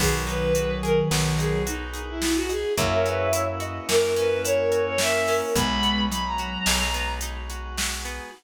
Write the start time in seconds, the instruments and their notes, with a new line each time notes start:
0.00 electric bass (finger) B1, ocarina D#3 F#3, acoustic guitar (steel) B3, drawbar organ B3 D#4 F#4 G#4, violin G#4, kick, crash
0.27 acoustic guitar (steel) D#4, violin B4, closed hi-hat
0.55 acoustic guitar (steel) F#4, closed hi-hat
0.83 acoustic guitar (steel) G#4, violin A#4, closed hi-hat
1.11 electric bass (finger) B1, acoustic guitar (steel) B3, snare
1.38 acoustic guitar (steel) D#4, violin G#4, closed hi-hat
1.67 violin D#4, acoustic guitar (steel) F#4, closed hi-hat
1.94 acoustic guitar (steel) G#4, closed hi-hat
2.08 violin E4
2.22 acoustic guitar (steel) B3, ocarina F#4, snare
2.36 violin F#4
2.49 acoustic guitar (steel) D#4, violin G#4, closed hi-hat
2.77 electric bass (finger) F#2, drawbar organ A#3 C#4 E4 F#4, acoustic guitar (steel) A#3, ocarina C#5 E5, kick, closed hi-hat
2.92 violin A#4
3.06 acoustic guitar (steel) C#4, violin B4, closed hi-hat
3.33 acoustic guitar (steel) E4, closed hi-hat
3.60 acoustic guitar (steel) F#4, ocarina D#5, closed hi-hat
3.89 electric bass (finger) F#2, acoustic guitar (steel) A#3, ocarina A#4, violin A#4, snare
4.16 acoustic guitar (steel) C#4, violin B4, closed hi-hat
4.44 acoustic guitar (steel) E4, violin C#5, closed hi-hat
4.72 acoustic guitar (steel) F#4, violin C#5, closed hi-hat
4.86 violin C#5
4.98 acoustic guitar (steel) A#3, ocarina A#4, violin E5, snare
5.28 acoustic guitar (steel) C#4, ocarina A#4, open hi-hat
5.56 electric bass (finger) B1, acoustic guitar (steel) G#3, ocarina G#3 B3, drawbar organ G#3 B3 D#4 F#4, violin B5, kick, closed hi-hat
5.83 acoustic guitar (steel) B3, closed hi-hat
6.10 ocarina F#3, acoustic guitar (steel) D#4, violin B5, closed hi-hat
6.25 violin A#5
6.38 acoustic guitar (steel) F#4, closed hi-hat
6.66 electric bass (finger) B1, acoustic guitar (steel) G#3, snare
6.94 acoustic guitar (steel) B3, closed hi-hat
7.21 acoustic guitar (steel) D#4, closed hi-hat
7.50 acoustic guitar (steel) F#4, closed hi-hat
7.77 acoustic guitar (steel) G#3, snare
8.05 acoustic guitar (steel) B3, closed hi-hat